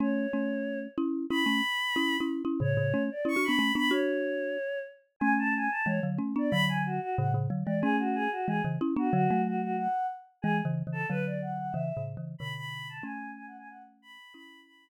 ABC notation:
X:1
M:4/4
L:1/16
Q:1/4=184
K:C#phr
V:1 name="Choir Aahs"
c12 z4 | b12 z4 | c6 d2 c'2 b4 b2 | c12 z4 |
g2 a2 g2 a2 c2 z4 d2 | b2 g2 F2 F2 f2 z4 d2 | G2 F2 G2 F2 G2 z4 F2 | F4 F2 F2 f4 z4 |
G2 z4 A2 B2 d2 f2 f2 | e4 z4 b2 b4 a2 | g4 (3g2 f2 g2 f2 z2 b4 | b4 b4 z8 |]
V:2 name="Marimba"
[A,C]4 [A,C]8 [CE]4 | [CE]2 [A,C]2 z4 [CE]3 [CE]3 [CE]2 | [A,,C,]2 [A,,C,]2 [A,C]2 z2 (3[CE]2 [DF]2 [B,D]2 [A,C]2 [B,D]2 | [DF]10 z6 |
[A,C]6 z2 [E,G,]2 [D,F,]2 [A,C]2 [B,D]2 | [D,F,]6 z2 [A,,C,]2 [A,,C,]2 [D,F,]2 [E,G,]2 | [A,C]6 z2 [E,G,]2 [C,E,]2 [CE]2 [B,D]2 | [D,F,]2 [F,A,]8 z6 |
(3[E,G,]4 [C,E,]4 [C,E,]4 [D,F,]8 | (3[C,E,]4 [A,,C,]4 [C,E,]4 [B,,D,]8 | [A,C]16 | [CE]8 z8 |]